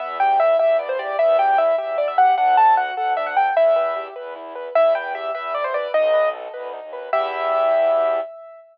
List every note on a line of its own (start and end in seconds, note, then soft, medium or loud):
0.00 0.55 E2 medium
0.00 0.18 B3 loud
0.00 0.17 E5 medium
0.20 0.38 G4 medium
0.20 0.39 G5 medium
0.40 0.58 E4 medium
0.40 0.57 E5 medium
0.59 1.13 E2 medium
0.59 0.77 G4 medium
0.59 0.77 E5 medium
0.79 0.97 B3 medium
0.79 0.88 D5 medium
0.89 0.98 C5 medium
0.99 1.17 G4 medium
0.99 1.17 D5 medium
1.18 1.72 E2 medium
1.18 1.36 B3 loud
1.18 1.37 E5 medium
1.39 1.56 G4 medium
1.39 1.57 G5 medium
1.58 1.76 E4 medium
1.58 1.76 E5 medium
1.78 2.32 E2 medium
1.78 1.96 G4 medium
1.78 1.97 E5 medium
1.98 2.16 B3 medium
1.98 2.07 D5 medium
2.08 2.17 E5 medium
2.18 2.36 G4 medium
2.18 2.34 F#5 medium
2.37 2.91 D2 medium
2.37 2.56 D4 loud
2.37 2.56 F#5 medium
2.57 2.75 A4 medium
2.57 2.75 A5 medium
2.77 2.95 F#4 medium
2.77 2.93 F#5 medium
2.97 3.50 D2 medium
2.97 3.15 A4 medium
2.97 3.13 F#5 medium
3.17 3.35 D4 medium
3.17 3.26 E5 medium
3.27 3.36 F#5 medium
3.37 3.54 A4 medium
3.37 3.55 G5 medium
3.55 4.08 E2 medium
3.55 3.74 E4 loud
3.55 4.07 E5 medium
3.76 3.94 B4 medium
3.96 4.14 G4 medium
4.16 4.69 E2 medium
4.16 4.34 B4 medium
4.36 4.54 E4 medium
4.55 4.73 B4 medium
4.75 5.30 E2 medium
4.75 4.93 E4 loud
4.75 4.94 E5 medium
4.95 5.13 B4 medium
4.95 5.13 G5 medium
5.15 5.33 G4 medium
5.15 5.31 E5 medium
5.34 5.87 E2 medium
5.34 5.53 B4 medium
5.34 5.54 E5 medium
5.54 5.72 E4 medium
5.54 5.64 D5 medium
5.64 5.74 C5 medium
5.74 5.92 B4 medium
5.74 5.91 D5 medium
5.94 6.47 B1 medium
5.94 6.12 D#4 loud
5.94 6.29 D#5 loud
6.14 6.31 B4 medium
6.34 6.52 A4 medium
6.53 6.79 D2 medium
6.53 6.71 B4 medium
6.73 6.91 D#4 medium
6.82 7.09 D#2 medium
6.93 7.11 B4 medium
7.12 8.20 E2 loud
7.12 8.20 B3 medium
7.12 8.20 E4 loud
7.12 8.20 G4 loud
7.12 8.20 E5 loud